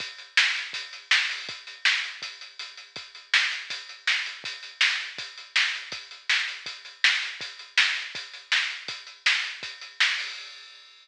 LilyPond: \new DrumStaff \drummode { \time 4/4 \tempo 4 = 162 <hh bd>8 hh8 sn8 hh8 <hh bd>8 hh8 sn8 hho8 | <hh bd>8 hh8 sn8 hh8 <hh bd>8 hh8 hh8 hh8 | <hh bd>8 hh8 sn8 hh8 <hh bd>8 hh8 sn8 hh8 | <hh bd>8 hh8 sn8 hh8 <hh bd>8 hh8 sn8 hh8 |
<hh bd>8 hh8 sn8 hh8 <hh bd>8 hh8 sn8 hh8 | <hh bd>8 hh8 sn8 hh8 <hh bd>8 hh8 sn8 hh8 | <hh bd>8 hh8 sn8 hh8 <hh bd>8 hh8 sn8 hho8 | }